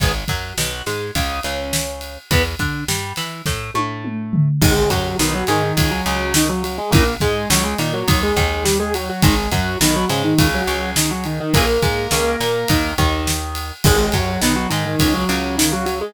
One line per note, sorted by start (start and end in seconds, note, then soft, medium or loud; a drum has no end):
0.00 0.25 G#1 medium
0.00 0.12 D#3 medium
0.00 0.12 G#3 medium
0.00 0.12 B3 medium
0.00 kick loud
0.00 ride medium
0.28 0.53 F#2 medium
0.28 0.53 F#3 medium
0.28 kick medium
0.28 ride medium
0.58 0.82 B1 medium
0.58 0.82 B2 medium
0.58 snare loud
0.86 1.11 G#2 medium
0.86 1.11 G#3 medium
0.86 snare medium
0.86 ride medium
1.15 1.40 C#2 medium
1.15 1.40 C#3 medium
1.15 kick medium
1.15 ride medium
1.43 2.18 C#2 medium
1.43 2.18 C#3 medium
1.43 ride medium
1.73 snare loud
2.01 ride medium
2.31 2.55 E2 medium
2.31 2.42 E3 medium
2.31 2.42 B3 medium
2.31 kick loud
2.31 ride loud
2.59 2.84 D3 medium
2.59 2.84 D4 medium
2.59 kick medium
2.59 ride medium
2.88 3.13 G2 medium
2.88 3.13 G3 medium
2.88 snare loud
3.16 3.42 E3 medium
3.16 3.42 E4 medium
3.16 snare medium
3.16 ride medium
3.46 3.71 A2 medium
3.46 3.71 A3 medium
3.46 kick medium
3.46 snare medium
3.74 4.49 A2 medium
3.74 4.49 A3 medium
3.74 high tom medium
4.05 mid tom medium
4.33 floor tom loud
4.62 4.86 G#1 loud
4.62 4.73 D#3 medium
4.62 4.90 G#3 loud
4.62 4.73 G#3 loud
4.62 4.90 G#4 loud
4.62 kick loud
4.62 crash loud
4.90 5.15 F#2 medium
4.90 5.17 F#3 medium
4.90 5.15 F#3 medium
4.90 5.17 F#4 loud
4.90 kick medium
4.90 ride medium
5.19 5.44 B1 medium
5.19 5.44 B2 medium
5.19 5.33 D#3 loud
5.19 5.33 D#4 loud
5.19 snare loud
5.34 5.48 F#3 medium
5.34 5.48 F#4 loud
5.47 5.73 G#2 medium
5.47 5.63 D#3 loud
5.47 5.73 G#3 medium
5.47 5.63 D#4 loud
5.47 snare medium
5.47 ride medium
5.63 5.90 D#3 medium
5.63 5.90 D#4 medium
5.77 6.01 C#2 medium
5.77 6.01 C#3 medium
5.77 kick medium
5.77 ride loud
5.91 6.33 F#3 loud
5.91 6.33 F#4 loud
6.06 6.79 C#2 medium
6.06 6.79 C#3 medium
6.06 ride medium
6.34 6.49 D#3 medium
6.34 6.49 D#4 loud
6.34 snare loud
6.49 6.62 F#3 medium
6.49 6.62 F#4 loud
6.63 6.77 F#3 medium
6.63 6.77 F#4 medium
6.63 ride medium
6.78 6.92 G#3 medium
6.78 6.92 G#4 loud
6.91 7.17 A#1 loud
6.91 7.04 C#3 loud
6.91 7.04 E3 medium
6.91 7.14 A#3 loud
6.91 7.14 A#4 loud
6.91 kick loud
6.91 ride loud
6.96 7.04 A#3 medium
7.20 7.46 G#2 medium
7.20 7.46 G#3 medium
7.20 7.48 G#3 loud
7.20 7.48 G#4 loud
7.20 kick medium
7.20 ride medium
7.50 7.75 C#2 medium
7.50 7.75 C#3 medium
7.50 7.64 F#3 medium
7.50 7.64 F#4 loud
7.50 snare loud
7.64 7.77 G#3 medium
7.64 7.77 G#4 loud
7.78 8.03 A#2 medium
7.78 7.92 D#3 loud
7.78 8.03 A#3 medium
7.78 7.92 D#4 loud
7.78 snare medium
7.78 ride medium
7.94 8.20 F#3 medium
7.94 8.20 F#4 loud
8.08 8.32 D#2 medium
8.08 8.32 D#3 medium
8.08 kick loud
8.08 ride loud
8.23 8.64 G#3 medium
8.23 8.64 G#4 loud
8.37 9.10 D#2 loud
8.37 9.10 D#3 medium
8.37 kick medium
8.37 ride medium
8.64 8.78 G3 medium
8.64 8.78 G4 medium
8.64 snare loud
8.80 8.93 G#3 medium
8.80 8.93 G#4 loud
8.94 9.08 F#3 medium
8.94 9.08 F#4 loud
8.94 ride medium
9.09 9.23 F#3 medium
9.09 9.23 F#4 medium
9.22 9.48 G#1 loud
9.22 9.35 D#3 medium
9.22 9.49 G#3 loud
9.22 9.35 G#3 medium
9.22 9.49 G#4 loud
9.22 kick loud
9.22 ride loud
9.51 9.76 F#2 medium
9.51 9.76 F#3 medium
9.51 9.78 F#3 medium
9.51 9.78 F#4 loud
9.51 kick medium
9.51 ride medium
9.81 10.05 B1 medium
9.81 10.05 B2 medium
9.81 9.95 D#3 loud
9.81 9.95 D#4 loud
9.81 snare loud
9.96 10.09 F#3 loud
9.96 10.09 F#4 loud
10.08 10.34 G#2 medium
10.08 10.22 C#3 medium
10.08 10.34 G#3 medium
10.08 10.22 C#4 loud
10.08 snare medium
10.08 ride medium
10.24 10.48 D#3 medium
10.24 10.48 D#4 medium
10.38 10.63 C#2 medium
10.38 10.63 C#3 medium
10.38 kick loud
10.38 ride loud
10.54 10.91 F#3 loud
10.54 10.91 F#4 loud
10.67 11.41 C#2 medium
10.67 11.41 C#3 medium
10.67 ride medium
10.96 11.10 D#3 medium
10.96 11.10 D#4 medium
10.96 snare loud
11.11 11.25 F#3 medium
11.11 11.25 F#4 loud
11.24 11.39 D#3 medium
11.24 11.39 D#4 medium
11.24 ride medium
11.40 11.54 D#3 loud
11.40 11.54 D#4 loud
11.54 11.78 A#1 medium
11.54 11.65 C#3 medium
11.54 11.65 E3 medium
11.54 12.91 A#3 loud
11.54 11.65 A#3 medium
11.54 12.91 A#4 loud
11.54 kick loud
11.54 ride loud
11.82 12.07 G#2 medium
11.82 12.07 G#3 medium
11.82 kick medium
11.82 ride medium
12.11 12.36 C#2 medium
12.11 12.36 C#3 medium
12.11 snare loud
12.40 12.65 A#2 medium
12.40 12.65 A#3 medium
12.40 snare medium
12.40 ride medium
12.68 12.94 D#2 medium
12.68 12.94 D#3 medium
12.68 kick loud
12.68 ride loud
12.98 13.72 D#2 loud
12.98 13.72 D#3 medium
12.98 kick medium
12.98 ride medium
13.27 snare loud
13.55 ride medium
13.84 14.09 G#1 loud
13.84 13.96 D#3 medium
13.84 14.13 G#3 loud
13.84 13.96 G#3 loud
13.84 14.13 G#4 loud
13.84 kick loud
13.84 crash loud
14.12 14.38 F#2 medium
14.12 14.38 F#3 medium
14.12 14.41 F#3 medium
14.12 14.41 F#4 loud
14.12 kick medium
14.12 ride medium
14.41 14.67 B1 medium
14.41 14.67 B2 medium
14.41 14.55 D#3 loud
14.41 14.55 D#4 loud
14.41 snare loud
14.56 14.69 F#3 medium
14.56 14.69 F#4 loud
14.70 14.96 G#2 medium
14.70 14.84 D#3 loud
14.70 14.96 G#3 medium
14.70 14.84 D#4 loud
14.70 snare medium
14.70 ride medium
14.86 15.13 D#3 medium
14.86 15.13 D#4 medium
14.99 15.25 C#2 medium
14.99 15.25 C#3 medium
14.99 kick medium
14.99 ride loud
15.13 15.56 F#3 loud
15.13 15.56 F#4 loud
15.29 16.02 C#2 medium
15.29 16.02 C#3 medium
15.29 ride medium
15.58 15.72 D#3 medium
15.58 15.72 D#4 loud
15.58 snare loud
15.72 15.85 F#3 medium
15.72 15.85 F#4 loud
15.86 15.99 F#3 medium
15.86 15.99 F#4 medium
15.86 ride medium
16.01 16.14 G#3 medium
16.01 16.14 G#4 loud